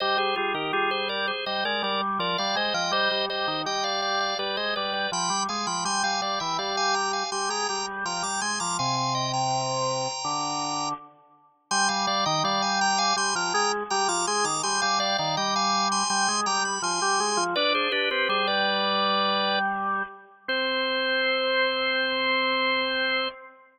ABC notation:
X:1
M:4/4
L:1/16
Q:1/4=82
K:Cm
V:1 name="Drawbar Organ"
[ce] [Ac] [FA] [GB] [FA] [Ac] [Bd] [Ac] [ce] [Bd] [Bd] z [Bd] [df] [ce] [eg] | [ce]2 [ce]2 [eg] [df] [df] [df] [=Bd] [ce] [Bd] [Bd] [g=b]2 [fa] [gb] | [ac'] [fa] [df] [=eg] [df] [fa] [gb] [fa] [ac'] [gb] [gb] z [gb] [bd'] [ac'] [bd'] | [fa] [fa] [eg] [gb]9 z4 |
[ac'] [fa] [df] [eg] [df] [fa] [gb] [fa] [ac'] [gb] [gb] z [gb] [bd'] [ac'] [bd'] | [ac'] [fa] [df] [df] [eg] [fa]2 [ac'] [ac']2 [gb] =b [ac']4 | [=Bd] [Ac] [GB] [GB] [Ac] [Bd]7 z4 | c16 |]
V:2 name="Drawbar Organ"
G, G, G, E, G,4 G, A, G,2 F, G, A, F, | G, G, G, E, G,4 G, A, G,2 F, G, A, F, | G, G, G, =E, G,4 G, A, G,2 F, G, A, F, | C,8 D,4 z4 |
G, G, G, E, G,4 G, F, A,2 G, F, A, E, | G, G, G, E, G,4 G, A, G,2 F, G, A, F, | D2 D C G,10 z2 | C16 |]